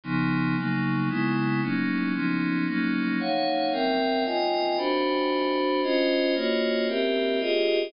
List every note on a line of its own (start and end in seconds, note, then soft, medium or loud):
0.04 0.56 C#3 medium
0.04 0.56 F3 medium
0.04 0.56 B3 medium
0.04 0.56 D#4 medium
0.56 1.08 C#3 medium
0.56 1.09 F#3 medium
0.56 1.09 A#3 medium
0.56 1.09 D#4 medium
1.09 1.61 C#3 medium
1.09 1.61 G#3 medium
1.09 1.61 B3 medium
1.09 1.61 E4 medium
1.62 2.14 F#3 medium
1.62 2.14 A#3 medium
1.62 2.13 C#4 medium
1.62 2.13 D#4 medium
2.14 2.66 F3 medium
2.14 2.66 B3 medium
2.14 2.66 C#4 medium
2.14 2.66 D#4 medium
2.67 3.19 F#3 medium
2.67 3.19 A#3 medium
2.67 3.19 C#4 medium
2.67 3.19 D#4 medium
3.20 3.72 D#4 medium
3.20 3.72 C#5 medium
3.20 3.72 F5 medium
3.20 3.72 F#5 medium
3.72 4.24 C4 medium
3.72 4.24 A#4 medium
3.72 4.24 E5 medium
3.72 4.24 G5 medium
4.25 4.77 F4 medium
4.25 4.77 D#5 medium
4.25 4.77 G5 medium
4.25 4.77 G#5 medium
4.77 5.81 D4 medium
4.77 5.81 F#4 medium
4.77 5.81 C5 medium
4.77 5.81 B5 medium
5.83 6.35 C#4 medium
5.83 6.35 F4 medium
5.83 6.35 C5 medium
5.83 6.35 D#5 medium
6.35 6.87 A#3 medium
6.35 6.87 F4 medium
6.35 6.87 F#4 medium
6.35 6.87 C#5 medium
6.35 6.87 D#5 medium
6.88 7.40 C4 medium
6.88 7.39 G4 medium
6.88 7.40 A#4 medium
6.88 7.40 E5 medium
7.40 7.92 F4 medium
7.40 7.92 G4 medium
7.40 7.92 G#4 medium
7.40 7.92 D#5 medium